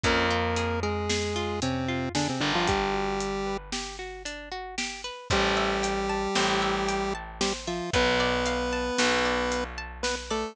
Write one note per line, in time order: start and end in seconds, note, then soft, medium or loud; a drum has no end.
0.04 2.29 F2 loud
0.04 0.80 A#3 medium
0.04 0.28 C#4 loud
0.04 0.80 A#4 loud
0.04 kick loud
0.04 closed hi-hat loud
0.30 0.54 F4 medium
0.56 0.80 G#4 medium
0.56 closed hi-hat loud
0.83 1.60 G#3 medium
0.83 1.60 G#4 medium
0.83 1.07 A#4 medium
1.09 1.33 G#4 loud
1.09 snare loud
1.36 1.59 F4 medium
1.62 2.09 C3 medium
1.62 2.09 C4 medium
1.62 1.86 C#4 medium
1.62 closed hi-hat loud
1.88 2.12 F4 medium
2.15 2.28 D3 medium
2.15 2.28 D4 medium
2.15 2.38 G#4 medium
2.15 snare loud
2.29 2.42 C3 medium
2.29 2.42 C4 medium
2.40 5.10 G1 loud
2.40 2.53 D3 medium
2.40 2.53 D4 medium
2.40 2.65 A#4 medium
2.55 2.68 F3 medium
2.55 2.68 F4 medium
2.67 3.57 G3 medium
2.67 2.91 D4 loud
2.67 3.57 G4 medium
2.67 kick loud
2.67 closed hi-hat loud
2.94 3.17 F#4 medium
3.20 3.44 G4 medium
3.20 closed hi-hat loud
3.46 3.70 B4 medium
3.72 3.96 G4 medium
3.72 snare loud
3.99 4.23 F#4 medium
4.25 4.49 D4 medium
4.25 closed hi-hat loud
4.52 4.75 F#4 medium
4.78 5.02 G4 loud
4.78 snare loud
5.04 5.28 B4 medium
5.30 6.27 A1 loud
5.30 7.14 G3 medium
5.30 7.14 G4 loud
5.30 6.35 C5 loud
5.30 kick loud
5.30 closed hi-hat loud
5.57 6.62 E5 medium
5.83 6.88 G5 medium
5.83 closed hi-hat loud
6.09 7.14 A5 medium
6.35 7.81 A1 medium
6.35 7.41 C5 medium
6.35 snare loud
6.62 7.67 E5 medium
6.88 7.88 G5 medium
6.88 closed hi-hat loud
7.15 7.90 A5 medium
7.41 7.53 G3 medium
7.41 7.53 G4 medium
7.41 7.91 C5 loud
7.41 snare loud
7.67 7.90 F3 medium
7.67 7.90 F4 medium
7.67 7.92 E5 medium
7.93 8.90 B1 loud
7.93 9.64 B3 medium
7.93 8.98 B4 loud
7.93 9.64 B4 loud
7.93 kick loud
7.93 closed hi-hat loud
8.20 9.25 D5 medium
8.46 9.51 F5 medium
8.46 closed hi-hat loud
8.73 9.77 A5 medium
8.98 10.44 B1 medium
8.98 10.04 B4 medium
8.98 snare loud
9.25 10.30 D5 medium
9.52 10.52 F5 medium
9.52 closed hi-hat loud
9.78 10.53 A5 medium
10.03 10.15 B3 medium
10.03 10.15 B4 medium
10.03 10.54 B4 medium
10.03 snare loud
10.30 10.56 A3 medium
10.30 10.56 A4 medium
10.30 10.55 D5 medium